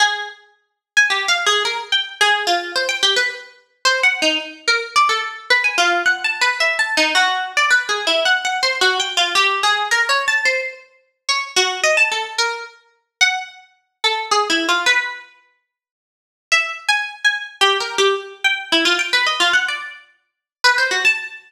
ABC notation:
X:1
M:3/4
L:1/16
Q:1/4=109
K:none
V:1 name="Harpsichord"
^G6 z ^g (3=G2 f2 ^G2 | ^A z g z ^G2 F2 c =g =G B | z4 (3c2 ^f2 ^D2 z2 ^A z | d A z2 B ^g F2 (3^f2 a2 B2 |
(3e2 a2 ^D2 ^F3 =d (3B2 ^G2 E2 | (3^f2 f2 c2 (3^F2 g2 =F2 G2 ^G2 | (3^A2 ^c2 =a2 =c4 z2 ^c2 | ^F2 ^d a A z ^A2 z4 |
^f6 A2 (3^G2 E2 =F2 | B12 | (3e4 ^g4 g4 (3=G2 ^A2 G2 | z2 g2 E F g B ^d F ^f =d |
z6 B c ^F a z2 |]